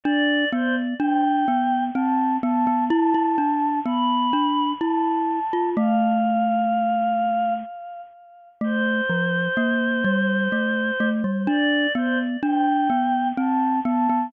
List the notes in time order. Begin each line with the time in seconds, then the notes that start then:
0.03 D4 D5
0.52 B3 C5
0.99 D4 G5
1.48 B3
1.94 C4 A5
2.43 B3 A5
2.67 B3
2.90 E4 A5
3.14 E4
3.38 D4
3.86 B3 B5
4.33 D4
4.80 E4 A5
5.53 F4
5.77 A3 F5
8.61 A3 C5
9.10 F3
9.57 A#3
10.04 G3
10.52 A3
11.00 A3
11.24 G3
11.47 D4 D5
11.95 B3 C5
12.43 D4 G5
12.90 B3
13.37 C4 A5
13.85 B3 A5
14.10 B3